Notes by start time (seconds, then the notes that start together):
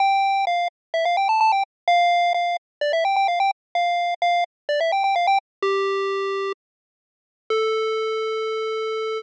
0.00 G5
0.47 F5
0.94 E5
1.05 F5
1.17 G5
1.29 A5
1.41 A5
1.52 G5
1.88 F5
2.34 F5
2.81 D5
2.93 E5
3.05 G5
3.16 G5
3.28 F5
3.40 G5
3.75 F5
4.22 F5
4.69 D5
4.80 E5
4.92 G5
5.04 G5
5.16 F5
5.27 G5
5.62 G4
7.50 A4